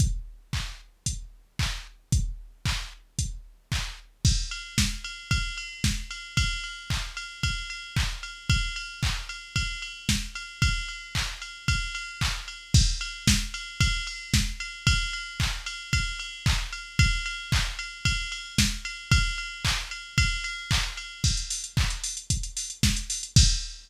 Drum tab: CC |----------------|----------------|x---------------|----------------|
RD |----------------|----------------|--x---x-x-x---x-|x-x---x-x-x---x-|
HH |x-------x-------|x-------x-------|----------------|----------------|
CP |----x-------x---|----x-------x---|----------------|----x-------x---|
SD |----------------|----------------|----o-------o---|----------------|
BD |o---o---o---o---|o---o---o---o---|o---o---o---o---|o---o---o---o---|

CC |----------------|----------------|x---------------|----------------|
RD |x-x---x-x-x---x-|x-x---x-x-x---x-|--x---x-x-x---x-|x-x---x-x-x---x-|
HH |----------------|----------------|----------------|----------------|
CP |----x-----------|----x-------x---|----------------|----x-------x---|
SD |------------o---|----------------|----o-------o---|----------------|
BD |o---o---o---o---|o---o---o---o---|o---o---o---o---|o---o---o---o---|

CC |----------------|----------------|x---------------|x---------------|
RD |x-x---x-x-x---x-|x-x---x-x-x---x-|----------------|----------------|
HH |----------------|----------------|-xox-xoxxxox-xox|----------------|
CP |----x-----------|----x-------x---|----x-----------|----------------|
SD |------------o---|----------------|------------o---|----------------|
BD |o---o---o---o---|o---o---o---o---|o---o---o---o---|o---------------|